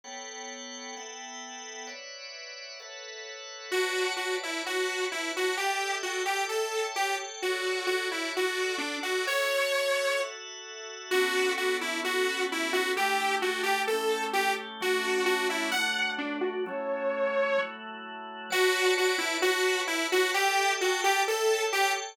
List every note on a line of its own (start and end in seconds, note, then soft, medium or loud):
0.04 0.95 B3 medium
0.04 0.95 A4 medium
0.04 0.95 C#5 medium
0.04 0.95 F#5 medium
0.04 0.95 G5 medium
0.97 1.88 B3 medium
0.97 1.88 A4 medium
0.97 1.86 E5 medium
0.97 1.86 F#5 medium
0.97 1.88 G5 medium
1.87 2.78 B4 medium
1.87 2.78 C#5 medium
1.87 2.78 D5 medium
1.87 2.78 E5 medium
1.87 2.78 F#5 medium
2.80 3.71 A4 medium
2.80 3.71 B4 medium
2.80 3.71 C#5 medium
2.80 3.71 E5 medium
2.80 3.71 F#5 medium
3.71 4.14 F#4 medium
3.71 4.64 B4 medium
3.71 4.64 C#5 medium
3.71 4.64 D5 medium
3.71 4.64 A5 medium
4.17 4.36 F#4 medium
4.43 4.62 E4 medium
4.65 5.06 F#4 medium
4.65 5.56 B4 medium
4.65 5.56 C#5 medium
4.65 5.56 F#5 medium
4.65 5.56 A5 medium
5.12 5.32 E4 medium
5.37 5.56 F#4 medium
5.57 5.96 G4 medium
5.57 6.02 A4 medium
5.57 6.02 D5 medium
5.57 6.04 E5 medium
5.57 6.02 G5 medium
6.03 6.23 F#4 medium
6.03 6.48 A4 medium
6.03 6.48 D5 medium
6.03 6.48 G5 medium
6.03 6.48 A5 medium
6.25 6.44 G4 medium
6.49 6.86 A4 medium
6.49 6.94 A4 medium
6.49 6.94 C#5 medium
6.49 6.95 E5 medium
6.49 6.94 G5 medium
6.95 7.16 G4 medium
6.95 7.40 A4 medium
6.95 7.40 C#5 medium
6.95 7.40 G5 medium
6.95 7.40 A5 medium
7.42 7.86 F#4 medium
7.42 8.34 F#4 medium
7.42 8.34 A4 medium
7.42 8.34 C#5 medium
7.42 8.34 D5 medium
7.87 8.08 F#4 medium
8.11 8.32 E4 medium
8.35 9.27 F#4 medium
8.35 8.77 F#4 medium
8.35 9.27 A4 medium
8.35 9.27 D5 medium
8.35 9.27 F#5 medium
8.78 8.97 D4 medium
9.03 9.25 F#4 medium
9.27 10.18 F#4 medium
9.27 10.18 A4 medium
9.27 10.20 C#5 medium
9.27 10.19 C#5 medium
9.27 10.18 E5 medium
10.19 11.10 F#4 medium
10.19 11.10 A4 medium
10.19 11.10 E5 medium
10.19 11.10 F#5 medium
11.11 12.02 B3 medium
11.11 12.02 C#4 medium
11.11 12.02 D4 medium
11.11 11.53 F#4 loud
11.11 12.02 A4 medium
11.57 11.77 F#4 medium
11.81 12.00 E4 medium
12.03 12.94 B3 medium
12.03 12.94 C#4 medium
12.03 12.94 F#4 medium
12.03 12.44 F#4 loud
12.03 12.94 A4 medium
12.52 12.72 E4 medium
12.73 12.92 F#4 loud
12.96 13.41 A3 medium
12.96 13.41 D4 medium
12.96 13.42 E4 loud
12.96 13.41 G4 medium
12.96 13.35 G4 loud
13.42 13.88 A3 medium
13.42 13.88 D4 medium
13.42 13.62 F#4 medium
13.42 13.88 G4 medium
13.42 13.88 A4 medium
13.63 13.82 G4 loud
13.87 14.35 A3 medium
13.87 14.35 C#4 medium
13.87 14.35 E4 medium
13.87 14.35 G4 medium
13.87 14.24 A4 medium
14.33 14.80 A3 medium
14.33 14.80 C#4 medium
14.33 14.53 G4 loud
14.33 14.82 G4 medium
14.33 14.82 A4 medium
14.81 15.72 F#3 medium
14.81 15.72 A3 medium
14.81 15.72 C#4 medium
14.81 15.72 D4 medium
14.81 15.25 F#4 loud
15.26 15.47 F#4 loud
15.50 15.70 E4 medium
15.71 16.65 F#3 medium
15.71 16.65 A3 medium
15.71 16.65 D4 medium
15.71 16.65 F#4 medium
15.71 16.12 F#5 loud
16.18 16.37 D4 medium
16.41 16.63 F#4 loud
16.66 17.57 F#3 medium
16.66 17.57 A3 medium
16.66 17.57 C#4 medium
16.66 17.57 E4 medium
16.66 17.60 C#5 loud
17.57 18.49 F#3 medium
17.57 18.49 A3 medium
17.57 18.49 E4 medium
17.57 18.49 F#4 medium
18.50 18.94 F#4 loud
18.50 19.42 B4 medium
18.50 19.42 C#5 loud
18.50 19.42 D5 loud
18.50 19.42 A5 loud
18.98 19.17 F#4 loud
19.18 19.37 E4 loud
19.42 19.82 F#4 loud
19.42 20.34 B4 medium
19.42 20.34 C#5 medium
19.42 20.34 F#5 medium
19.42 20.34 A5 loud
19.87 20.07 E4 loud
20.12 20.31 F#4 loud
20.33 20.73 G4 loud
20.33 20.78 A4 medium
20.33 20.78 D5 medium
20.33 20.79 E5 loud
20.33 20.78 G5 loud
20.79 21.01 F#4 medium
20.79 21.25 A4 loud
20.79 21.25 D5 medium
20.79 21.25 G5 loud
20.79 21.25 A5 medium
21.04 21.22 G4 loud
21.28 21.65 A4 loud
21.28 21.73 A4 medium
21.28 21.73 C#5 medium
21.28 21.74 E5 loud
21.28 21.73 G5 medium
21.72 21.92 G4 loud
21.72 22.16 A4 medium
21.72 22.16 C#5 loud
21.72 22.16 G5 loud
21.72 22.16 A5 medium